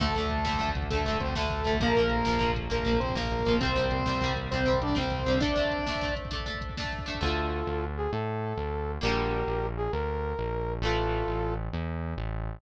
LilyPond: <<
  \new Staff \with { instrumentName = "Lead 2 (sawtooth)" } { \time 12/8 \key d \minor \tempo 4. = 133 <a a'>2~ <a a'>8 r8 <a a'>4 <c' c''>8 <a a'>4. | <bes bes'>2~ <bes bes'>8 r8 <bes bes'>4 <c' c''>8 <bes bes'>4. | <c' c''>2~ <c' c''>8 r8 <c' c''>4 <d' d''>8 <c' c''>4. | <d' d''>2~ <d' d''>8 r2. r8 |
r1. | r1. | r1. | }
  \new Staff \with { instrumentName = "Brass Section" } { \time 12/8 \key d \minor r1. | r1. | r1. | r1. |
<f' a'>2~ <f' a'>8 gis'8 a'2. | <g' bes'>2~ <g' bes'>8 aes'8 bes'2. | <f' a'>2~ <f' a'>8 r2. r8 | }
  \new Staff \with { instrumentName = "Acoustic Guitar (steel)" } { \time 12/8 \key d \minor <d a>8 <d a>4 <d a>8 <d a>4 <d a>8 <d a>4 <d a>4 <d a>8 | <f bes>8 <f bes>4 <f bes>8 <f bes>4 <f bes>8 <f bes>4 <f bes>4 <f bes>8 | <g c'>8 <g c'>4 <g c'>8 <g c'>4 <g c'>8 <g c'>4 <g c'>4 <g c'>8 | <a d'>8 <a d'>4 <a d'>8 <a d'>4 <a d'>8 <a d'>4 <a d'>4 <a d'>8 |
<d a>1. | <d g bes>1. | <e a>1. | }
  \new Staff \with { instrumentName = "Synth Bass 1" } { \clef bass \time 12/8 \key d \minor d,8 d,8 d,8 d,8 d,8 d,8 d,8 d,8 d,8 d,8 d,8 d,8 | bes,,8 bes,,8 bes,,8 bes,,8 bes,,8 bes,,8 bes,,8 bes,,8 bes,,8 bes,,8 bes,,8 bes,,8 | c,8 c,8 c,8 c,8 c,8 c,8 c,8 c,8 c,8 c,8 c,8 c,8 | r1. |
d,4. d,4. a,4. d,4. | bes,,4. bes,,4. d,4. bes,,4. | a,,4. a,,4. e,4. a,,4. | }
  \new DrumStaff \with { instrumentName = "Drums" } \drummode { \time 12/8 <cymc bd>16 bd16 <hh bd>16 bd16 <hh bd>16 bd16 <bd sn>16 bd16 <hh bd>16 bd16 <hh bd>16 bd16 <hh bd>16 bd16 <hh bd>16 bd16 <hh bd>16 bd16 <bd sn>16 bd16 <hh bd>16 bd16 <hh bd>16 bd16 | <hh bd>16 bd16 <hh bd>16 bd16 <hh bd>16 bd16 <bd sn>16 bd16 <hh bd>16 bd16 <hh bd>16 bd16 <hh bd>16 bd16 <hh bd>16 bd16 <hh bd>16 bd16 <bd sn>16 bd16 <hh bd>16 bd16 <hh bd>16 bd16 | <hh bd>16 bd16 <hh bd>16 bd16 <hh bd>16 bd16 <bd sn>16 bd16 <hh bd>16 bd16 <hh bd>16 bd16 <hh bd>16 bd16 <hh bd>16 bd16 <hh bd>16 bd16 <bd sn>16 bd16 <hh bd>16 bd16 <hh bd>16 bd16 | <hh bd>16 bd16 <hh bd>16 bd16 <hh bd>16 bd16 <bd sn>16 bd16 <hh bd>16 bd16 <hh bd>16 bd16 <hh bd>16 bd16 <hh bd>16 bd16 <hh bd>16 bd16 <bd sn>16 bd16 <hh bd>16 bd16 <hh bd>16 bd16 |
r4. r4. r4. r4. | r4. r4. r4. r4. | r4. r4. r4. r4. | }
>>